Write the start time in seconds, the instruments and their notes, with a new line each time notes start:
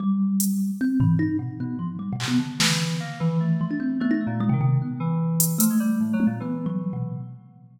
0.00 kalimba G3
0.40 closed hi-hat
0.81 kalimba C4
1.00 kalimba E3, floor tom
1.19 kalimba D#4
1.39 kalimba B2
1.60 electric piano 2 B2, kalimba B3
1.79 kalimba F3
1.99 kalimba G3
2.13 kalimba B2
2.20 electric piano 2 C3, clap
2.28 kalimba B3
2.38 kalimba D3
2.60 kalimba D3, electric piano 2 E3, snare
3.00 electric piano 2 A#3
3.20 electric piano 2 E3, kalimba E3
3.40 electric piano 2 A3
3.61 kalimba F3
3.71 kalimba D4
3.80 kalimba C4
4.00 electric piano 2 A3, kalimba B3
4.11 kalimba D#4
4.21 kalimba A3
4.27 electric piano 2 A#2
4.40 kalimba G#3
4.49 kalimba C3, electric piano 2 D#3
4.61 kalimba C3
4.82 kalimba B3
5.00 electric piano 2 E3
5.40 closed hi-hat
5.58 electric piano 2 F3, kalimba A3, closed hi-hat
5.70 electric piano 2 G#3
5.80 electric piano 2 G3
6.00 electric piano 2 A2
6.13 electric piano 2 F#3
6.20 high tom
6.27 electric piano 2 A#2
6.40 electric piano 2 E3, kalimba B3
6.66 kalimba F#3
6.93 kalimba B2